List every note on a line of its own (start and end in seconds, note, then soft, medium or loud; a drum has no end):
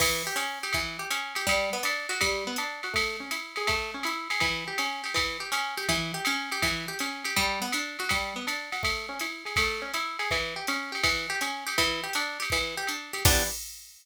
0.00 0.23 E3 medium
0.00 kick medium
0.00 crash medium
0.00 ride medium
0.27 0.37 G4 medium
0.36 0.59 C#4 medium
0.36 hi-hat pedal medium
0.36 ride medium
0.63 0.73 G4 medium
0.63 ride medium
0.73 0.97 E3 medium
0.73 kick soft
0.73 ride medium
0.99 1.09 G4 medium
1.11 1.34 C#4 medium
1.11 hi-hat pedal medium
1.11 ride medium
1.35 1.46 G4 medium
1.35 ride medium
1.47 1.70 G3 medium
1.47 kick soft
1.47 ride medium
1.73 1.83 B3 medium
1.83 2.07 D4 medium
1.83 hi-hat pedal medium
1.83 ride medium
2.09 2.19 F#4 medium
2.09 ride medium
2.21 2.44 G3 medium
2.21 kick soft
2.21 ride medium
2.47 2.57 B3 medium
2.56 2.81 D4 medium
2.56 hi-hat pedal medium
2.56 ride medium
2.83 2.94 F#4 medium
2.83 ride medium
2.93 3.17 A3 medium
2.93 kick soft
2.93 ride medium
3.20 3.30 C#4 medium
3.31 3.55 E4 medium
3.31 hi-hat pedal medium
3.31 ride medium
3.56 3.67 G#4 medium
3.56 ride medium
3.67 3.91 A3 medium
3.67 kick medium
3.67 ride medium
3.94 4.04 C#4 medium
4.03 4.28 E4 medium
4.03 hi-hat pedal medium
4.03 ride medium
4.30 4.41 G#4 medium
4.30 ride medium
4.40 4.64 E3 medium
4.40 kick soft
4.40 ride medium
4.68 4.78 G4 medium
4.78 5.02 C#4 medium
4.78 hi-hat pedal medium
4.78 ride medium
5.04 5.14 G4 medium
5.04 ride medium
5.14 5.37 E3 medium
5.14 kick soft
5.14 ride medium
5.40 5.50 G4 medium
5.52 5.75 C#4 medium
5.52 hi-hat pedal medium
5.52 ride medium
5.77 5.87 G4 medium
5.77 ride medium
5.89 6.12 E3 medium
5.89 kick soft
5.89 ride medium
6.14 6.24 G4 medium
6.25 6.50 C#4 medium
6.25 hi-hat pedal medium
6.25 ride medium
6.52 6.62 G4 medium
6.52 ride medium
6.62 6.86 E3 medium
6.62 kick medium
6.62 ride medium
6.88 6.98 G4 medium
6.99 7.24 C#4 medium
6.99 hi-hat pedal medium
6.99 ride medium
7.24 7.35 G4 medium
7.24 ride medium
7.36 7.60 G3 loud
7.36 kick soft
7.36 ride medium
7.62 7.72 B3 medium
7.72 7.97 D4 medium
7.72 hi-hat pedal medium
7.72 ride medium
7.99 8.10 F#4 medium
7.99 ride medium
8.09 8.34 G3 medium
8.09 kick soft
8.09 ride medium
8.36 8.46 B3 medium
8.47 8.70 D4 medium
8.47 hi-hat pedal medium
8.47 ride medium
8.72 8.82 F#4 medium
8.72 ride medium
8.83 9.06 A3 medium
8.83 kick medium
8.83 ride medium
9.09 9.19 C#4 medium
9.19 9.44 E4 medium
9.19 hi-hat pedal medium
9.19 ride medium
9.45 9.55 G#4 medium
9.45 ride medium
9.56 9.81 A3 medium
9.56 kick medium
9.56 ride loud
9.82 9.92 C#4 medium
9.94 10.17 E4 medium
9.94 hi-hat pedal medium
9.94 ride medium
10.19 10.29 G#4 medium
10.19 ride medium
10.31 10.54 E3 medium
10.31 kick medium
10.31 ride medium
10.56 10.66 G4 medium
10.67 10.91 C#4 medium
10.67 hi-hat pedal medium
10.67 ride medium
10.92 11.02 G4 medium
10.92 ride medium
11.04 11.27 E3 medium
11.04 kick medium
11.04 ride medium
11.30 11.40 G4 medium
11.41 11.64 C#4 medium
11.41 hi-hat pedal medium
11.41 ride medium
11.67 11.77 G4 medium
11.67 ride medium
11.78 12.01 E3 medium
11.78 kick soft
11.78 ride medium
12.04 12.13 G4 medium
12.13 12.38 D4 medium
12.13 hi-hat pedal medium
12.13 ride medium
12.40 12.50 G4 medium
12.40 ride medium
12.50 12.75 E3 medium
12.50 kick medium
12.50 ride medium
12.77 12.87 G4 medium
12.87 13.12 D4 medium
12.87 hi-hat pedal medium
12.87 ride medium
13.13 13.23 G4 medium
13.13 ride medium
13.25 13.43 E3 loud
13.25 13.43 B3 loud
13.25 13.43 D4 medium
13.25 13.43 G4 medium
13.25 kick loud
13.25 crash loud